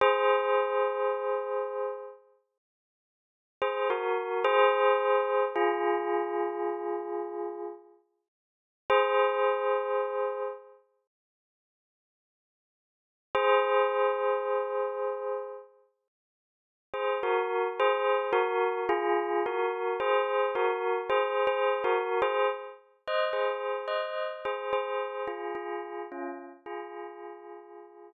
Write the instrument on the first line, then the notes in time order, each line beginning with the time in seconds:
tubular bells
0.01 G#4 C5
3.62 G#4 C5
3.90 F#4 A#4
4.44 G#4 C5
5.56 F4 G#4
8.90 G#4 C5
13.35 G#4 C5
16.94 G#4 C5
17.23 F#4 A#4
17.80 G#4 C5
18.33 F#4 A#4
18.89 F4 G#4
19.46 F#4 A#4
20.00 G#4 C5
20.55 F#4 A#4
21.09 G#4 C5
21.47 G#4 C5
21.84 F#4 A#4
22.22 G#4 C5
23.07 C5 D#5
23.33 G#4 C5
23.88 C5 D#5
24.45 G#4 C5
24.73 G#4 C5
25.28 F4 G#4
25.55 F4 G#4
26.12 C#4 F4
26.66 F4 G#4